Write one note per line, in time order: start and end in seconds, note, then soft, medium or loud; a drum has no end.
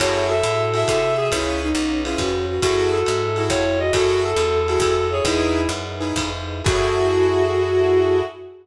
0.00 0.42 F#2 medium
0.00 0.33 E4 loud
0.00 1.30 E4 medium
0.00 0.33 F#4 loud
0.00 1.30 F#4 medium
0.00 0.24 F#4 medium
0.00 0.33 G#4 loud
0.00 1.30 G#4 medium
0.00 0.33 A4 medium
0.00 1.30 A4 medium
0.00 0.27 C#5 medium
0.00 kick medium
0.00 crash loud
0.00 ride loud
0.29 0.79 A4 medium
0.29 0.62 E5 medium
0.43 0.84 A2 medium
0.43 hi-hat pedal medium
0.43 ride medium
0.74 0.99 E4 medium
0.74 0.99 F#4 medium
0.74 0.99 G#4 medium
0.74 0.99 A4 medium
0.74 1.28 E5 medium
0.74 ride medium
0.88 1.30 C3 medium
0.88 1.14 A4 medium
0.88 kick medium
0.88 ride loud
1.18 1.30 G#4 medium
1.31 1.73 C#2 medium
1.31 2.62 C#4 medium
1.31 1.68 C#4 loud
1.31 1.59 E4 medium
1.31 2.62 F4 medium
1.31 1.68 F4 medium
1.31 2.62 G#4 medium
1.31 1.68 G#4 loud
1.31 2.62 B4 medium
1.31 1.68 B4 loud
1.31 kick medium
1.31 ride loud
1.62 2.00 D#4 medium
1.75 2.16 B1 medium
1.75 hi-hat pedal medium
1.75 ride medium
2.05 2.32 C#4 medium
2.05 2.19 E4 medium
2.05 2.32 F4 medium
2.05 2.32 G#4 medium
2.05 2.32 B4 medium
2.05 ride medium
2.18 2.59 F2 medium
2.18 2.45 F#4 medium
2.18 kick medium
2.18 ride loud
2.49 2.61 F#4 medium
2.62 3.04 F#2 medium
2.62 2.98 E4 loud
2.62 3.93 E4 medium
2.62 2.98 F#4 loud
2.62 2.90 F#4 medium
2.62 3.93 F#4 medium
2.62 3.21 F#4 medium
2.62 2.98 G#4 loud
2.62 3.93 G#4 medium
2.62 2.98 A4 loud
2.62 3.93 A4 medium
2.62 kick medium
2.62 ride loud
2.92 3.43 A4 medium
3.06 3.49 G#2 medium
3.06 hi-hat pedal medium
3.06 ride medium
3.36 3.63 E4 medium
3.36 3.77 E4 medium
3.36 3.63 F#4 medium
3.36 3.63 G#4 medium
3.36 3.63 A4 medium
3.36 ride medium
3.50 3.91 F2 medium
3.50 3.79 C#5 medium
3.50 kick medium
3.50 ride loud
3.79 3.91 F#4 medium
3.79 3.92 D#5 medium
3.93 4.34 F#2 medium
3.93 5.25 E4 medium
3.93 4.30 E4 loud
3.93 4.22 F#4 medium
3.93 5.25 F#4 medium
3.93 4.30 F#4 medium
3.93 5.25 G#4 medium
3.93 4.30 G#4 loud
3.93 4.57 A4 medium
3.93 5.25 A4 medium
3.93 4.30 A4 loud
3.93 kick medium
3.93 ride loud
4.24 4.79 A4 medium
4.36 4.77 E2 medium
4.36 hi-hat pedal medium
4.36 ride medium
4.68 4.95 E4 medium
4.68 5.06 F#4 medium
4.68 4.95 F#4 medium
4.68 4.95 G#4 medium
4.68 4.95 A4 medium
4.68 ride medium
4.80 5.21 F2 medium
4.80 5.11 A4 medium
4.80 kick medium
4.80 ride loud
5.11 5.24 G#4 medium
5.11 5.23 C#5 medium
5.25 5.67 E2 medium
5.25 5.61 D#4 loud
5.25 6.66 D#4 medium
5.25 5.61 E4 loud
5.25 6.66 E4 medium
5.25 5.68 E4 medium
5.25 5.61 G#4 loud
5.25 6.66 G#4 medium
5.25 5.67 G#4 medium
5.25 5.61 B4 loud
5.25 6.66 B4 medium
5.25 kick medium
5.25 ride loud
5.69 6.13 F#2 medium
5.69 hi-hat pedal medium
5.69 ride medium
6.00 6.29 D#4 medium
6.00 6.29 E4 medium
6.00 6.29 G#4 medium
6.00 6.29 B4 medium
6.00 ride medium
6.16 6.62 F2 medium
6.16 kick medium
6.16 ride loud
6.64 8.23 F#2 loud
6.64 8.21 E4 loud
6.64 8.23 E4 loud
6.64 8.21 F#4 medium
6.64 8.23 F#4 loud
6.64 8.21 G#4 loud
6.64 8.23 G#4 loud
6.64 8.21 A4 medium
6.64 8.23 A4 loud
6.64 kick loud
6.64 crash loud